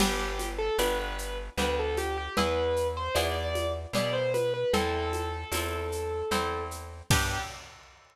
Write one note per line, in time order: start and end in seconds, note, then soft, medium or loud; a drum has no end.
0.00 0.70 G1 medium
0.00 0.71 B3 medium
0.00 0.71 D4 medium
0.00 0.48 G4 medium
0.00 0.71 G4 medium
0.00 crash medium
0.00 low conga medium
0.00 shaker medium
0.39 high conga medium
0.39 shaker medium
0.58 0.77 A4 medium
0.78 1.50 G1 medium
0.78 1.50 B3 medium
0.78 1.50 D4 medium
0.78 1.50 G4 medium
0.78 0.98 B4 medium
0.78 tambourine medium
0.78 high conga medium
0.78 shaker medium
1.00 1.37 B4 medium
1.18 shaker medium
1.58 2.29 D2 medium
1.58 2.29 B3 medium
1.58 2.29 D4 medium
1.58 2.29 G4 medium
1.58 1.76 B4 medium
1.58 low conga medium
1.58 shaker medium
1.79 1.98 A4 medium
1.97 2.16 G4 medium
1.97 high conga medium
1.97 shaker medium
2.17 2.36 G4 medium
2.37 3.09 E2 loud
2.37 3.08 B3 medium
2.37 3.08 E4 medium
2.37 3.08 G#4 medium
2.37 2.87 B4 medium
2.37 low conga medium
2.37 shaker medium
2.76 shaker medium
2.97 3.15 C5 medium
3.14 3.86 E2 medium
3.14 3.87 B3 medium
3.14 3.87 E4 medium
3.14 3.87 G#4 medium
3.14 3.33 D5 medium
3.14 tambourine medium
3.14 high conga medium
3.14 shaker medium
3.35 3.72 D5 medium
3.55 high conga medium
3.55 shaker medium
3.93 4.64 B2 medium
3.93 4.66 B3 medium
3.93 4.66 E4 medium
3.93 4.66 G#4 medium
3.93 4.14 D5 medium
3.93 low conga medium
3.93 shaker medium
4.13 4.32 C5 medium
4.34 4.53 B4 medium
4.34 high conga medium
4.34 shaker medium
4.54 4.72 B4 medium
4.73 5.45 E2 loud
4.73 5.45 C4 medium
4.73 5.45 E4 medium
4.73 6.63 A4 medium
4.73 5.45 A4 medium
4.73 low conga medium
4.73 shaker medium
5.13 high conga medium
5.13 shaker medium
5.52 6.23 E2 medium
5.52 6.25 C4 medium
5.52 6.25 E4 medium
5.52 6.25 A4 medium
5.52 tambourine medium
5.52 high conga medium
5.52 shaker medium
5.92 shaker medium
6.31 7.02 E2 medium
6.31 7.03 C4 medium
6.31 7.03 E4 medium
6.31 7.03 A4 medium
6.31 low conga medium
6.31 shaker medium
6.71 shaker medium
7.10 7.38 G2 loud
7.10 7.38 B3 medium
7.10 7.38 D4 medium
7.10 7.38 G4 loud
7.10 7.40 G4 loud
7.10 kick loud
7.10 crash loud